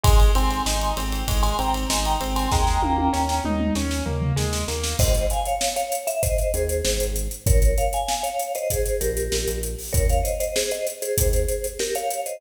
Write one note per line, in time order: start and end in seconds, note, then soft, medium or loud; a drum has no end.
0.03 0.31 G#1 medium
0.03 0.31 G#3 loud
0.03 0.19 G#5 medium
0.03 0.19 C6 medium
0.03 kick loud
0.03 ride loud
0.20 ride medium
0.35 0.61 G#1 medium
0.35 0.63 C4 loud
0.35 0.62 G#5 medium
0.35 0.62 C6 medium
0.35 ride medium
0.51 ride medium
0.66 0.92 G#1 medium
0.66 0.94 D#4 medium
0.66 0.92 G#5 medium
0.66 0.92 C6 medium
0.66 snare loud
0.81 ride medium
0.97 1.23 G#1 medium
0.97 1.25 C4 medium
0.97 ride loud
1.12 ride medium
1.28 1.54 G#1 medium
1.28 1.55 G#3 medium
1.28 kick loud
1.28 ride loud
1.43 1.57 G#5 medium
1.43 1.57 C6 medium
1.43 ride medium
1.59 1.85 G#1 medium
1.59 1.87 C4 medium
1.59 1.74 G5 medium
1.59 1.74 A#5 medium
1.59 ride medium
1.74 ride medium
1.90 2.16 G#1 medium
1.90 2.18 D#4 medium
1.90 2.05 G#5 medium
1.90 2.05 C6 medium
1.90 snare loud
2.05 2.20 G5 medium
2.05 2.20 A#5 medium
2.05 ride medium
2.21 2.47 G#1 medium
2.21 2.48 C4 medium
2.21 ride medium
2.36 2.51 G#5 medium
2.36 2.51 C6 medium
2.36 ride medium
2.52 2.78 D#2 medium
2.52 2.80 G#3 loud
2.52 3.43 G5 medium
2.52 3.43 A#5 medium
2.52 kick loud
2.52 snare loud
2.67 snare medium
2.82 3.09 D#2 medium
2.82 3.10 A#3 medium
2.82 high tom loud
2.98 high tom loud
3.13 3.40 D#2 medium
3.13 3.41 C#4 medium
3.13 snare medium
3.29 snare medium
3.44 3.71 D#2 medium
3.44 3.73 D#4 medium
3.44 mid tom medium
3.60 mid tom loud
3.75 4.02 D#2 medium
3.75 4.04 C#4 medium
3.75 snare medium
3.91 snare medium
4.06 4.33 D#2 medium
4.06 4.34 A#3 medium
4.06 floor tom medium
4.22 floor tom loud
4.36 4.64 D#2 medium
4.36 4.64 G#3 loud
4.36 snare loud
4.53 snare loud
4.68 4.94 D#2 medium
4.68 4.96 A#3 medium
4.68 snare loud
4.84 snare loud
4.99 5.27 G#1 medium
4.99 5.26 C5 medium
4.99 5.26 D#5 medium
4.99 kick loud
4.99 crash loud
5.14 closed hi-hat medium
5.30 5.46 F5 medium
5.30 5.46 G#5 medium
5.30 closed hi-hat medium
5.45 5.73 C#5 medium
5.45 5.73 F5 medium
5.45 closed hi-hat medium
5.61 snare loud
5.76 6.01 C#5 medium
5.76 6.01 F5 medium
5.76 closed hi-hat medium
5.92 closed hi-hat medium
6.07 6.22 E5 medium
6.07 closed hi-hat medium
6.23 6.52 C5 medium
6.23 6.52 D#5 medium
6.23 kick loud
6.23 closed hi-hat loud
6.38 closed hi-hat medium
6.54 6.82 D#2 medium
6.54 7.07 G#4 medium
6.54 7.07 C5 medium
6.54 closed hi-hat medium
6.69 closed hi-hat medium
6.85 6.99 G#1 medium
6.85 snare loud
7.00 7.28 G#1 medium
7.00 closed hi-hat medium
7.16 closed hi-hat medium
7.31 closed hi-hat medium
7.46 7.74 A#1 medium
7.46 7.76 A#4 medium
7.46 7.76 C#5 medium
7.46 kick loud
7.46 closed hi-hat loud
7.62 closed hi-hat medium
7.78 7.93 C#5 medium
7.78 7.93 F5 medium
7.78 closed hi-hat medium
7.93 8.23 F5 medium
7.93 8.24 G#5 medium
7.93 closed hi-hat medium
8.08 snare loud
8.23 8.52 C#5 medium
8.23 8.52 F5 medium
8.23 closed hi-hat medium
8.39 closed hi-hat medium
8.55 8.70 C5 medium
8.55 8.70 D#5 medium
8.55 closed hi-hat medium
8.70 8.99 G#4 medium
8.70 8.99 C5 medium
8.70 kick medium
8.70 closed hi-hat loud
8.86 closed hi-hat medium
9.01 9.29 A#1 medium
9.01 9.58 G4 medium
9.01 9.58 A#4 medium
9.01 closed hi-hat loud
9.17 closed hi-hat medium
9.32 9.46 A#1 medium
9.32 snare loud
9.48 9.75 A#1 medium
9.48 closed hi-hat medium
9.63 closed hi-hat medium
9.78 open hi-hat medium
9.93 10.22 D#2 medium
9.93 10.07 A#4 medium
9.93 10.07 C#5 medium
9.93 kick loud
9.93 closed hi-hat loud
10.09 10.25 C#5 medium
10.09 10.25 F5 medium
10.09 closed hi-hat medium
10.23 10.38 C5 medium
10.23 10.38 D#5 medium
10.23 closed hi-hat medium
10.40 10.55 C5 medium
10.40 10.55 D#5 medium
10.40 closed hi-hat medium
10.56 10.71 G#4 medium
10.56 10.71 C5 medium
10.56 snare loud
10.71 10.86 C5 medium
10.71 10.86 D#5 medium
10.71 closed hi-hat medium
10.87 closed hi-hat medium
11.02 11.66 G#4 medium
11.02 11.66 C5 medium
11.02 closed hi-hat medium
11.18 11.45 D#2 medium
11.18 kick loud
11.18 closed hi-hat loud
11.33 closed hi-hat medium
11.48 closed hi-hat medium
11.64 closed hi-hat medium
11.79 11.95 G4 medium
11.79 11.95 A#4 medium
11.79 snare loud
11.95 12.21 C#5 medium
11.95 12.21 F5 medium
11.95 closed hi-hat medium
12.10 closed hi-hat medium
12.26 12.41 C5 medium
12.26 12.41 D#5 medium
12.26 closed hi-hat medium